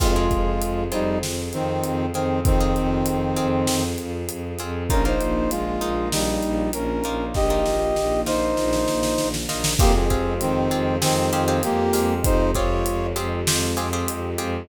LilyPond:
<<
  \new Staff \with { instrumentName = "Brass Section" } { \time 4/4 \key f \minor \tempo 4 = 98 <aes f'>4. <g ees'>8 r8 <ees c'>4 <ees c'>8 | <ees c'>2~ <ees c'>8 r4. | <des' bes'>16 <ees' c''>8. <aes f'>4 <g ees'>4 <des' bes'>4 | <g' ees''>4. <ees' c''>2 r8 |
<bes g'>16 <c' aes'>8. <ees c'>4 <ees c'>4 <bes g'>4 | <ees' c''>8 <f' des''>4 r2 r8 | }
  \new Staff \with { instrumentName = "Orchestral Harp" } { \time 4/4 \key f \minor <c' f' aes'>16 <c' f' aes'>4~ <c' f' aes'>16 <c' f' aes'>2 <c' f' aes'>8~ | <c' f' aes'>16 <c' f' aes'>4~ <c' f' aes'>16 <c' f' aes'>2 <c' f' aes'>8 | <bes ees' f'>16 <bes ees' f'>4~ <bes ees' f'>16 <bes ees' f'>2 <bes ees' f'>8~ | <bes ees' f'>16 <bes ees' f'>4~ <bes ees' f'>16 <bes ees' f'>2 <bes ees' f'>8 |
<c' f' g' aes'>8 <c' f' g' aes'>4 <c' f' g' aes'>8 <c' f' g' aes'>8 <c' f' g' aes'>16 <c' f' g' aes'>8. <c' f' g' aes'>8~ | <c' f' g' aes'>8 <c' f' g' aes'>4 <c' f' g' aes'>8 <c' f' g' aes'>8 <c' f' g' aes'>16 <c' f' g' aes'>8. <c' f' g' aes'>8 | }
  \new Staff \with { instrumentName = "Violin" } { \clef bass \time 4/4 \key f \minor f,8 f,8 f,8 f,8 f,8 f,8 f,8 f,8 | f,8 f,8 f,8 f,8 f,8 f,8 f,8 f,8 | bes,,8 bes,,8 bes,,8 bes,,8 bes,,8 bes,,8 bes,,8 bes,,8 | bes,,8 bes,,8 bes,,8 bes,,8 bes,,8 bes,,8 bes,,8 bes,,8 |
f,8 f,8 f,8 f,8 f,8 f,8 f,8 f,8 | f,8 f,8 f,8 f,8 f,8 f,8 f,8 f,8 | }
  \new Staff \with { instrumentName = "String Ensemble 1" } { \time 4/4 \key f \minor <c' f' aes'>1~ | <c' f' aes'>1 | <bes ees' f'>1~ | <bes ees' f'>1 |
<aes c' f' g'>1~ | <aes c' f' g'>1 | }
  \new DrumStaff \with { instrumentName = "Drums" } \drummode { \time 4/4 <cymc bd>8 <hh bd>8 hh8 hh8 sn8 hh8 hh8 hh8 | <hh bd>8 hh8 hh8 hh8 sn8 hh8 hh8 hh8 | <hh bd>8 hh8 hh8 hh8 sn8 hh8 hh8 hh8 | <bd sn>8 sn8 sn8 sn8 sn16 sn16 sn16 sn16 sn16 sn16 sn16 sn16 |
<cymc bd>8 <hh bd>8 hh8 hh8 sn8 hh8 hh8 hho8 | <hh bd>8 <hh bd>8 hh8 hh8 sn8 hh8 hh8 hh8 | }
>>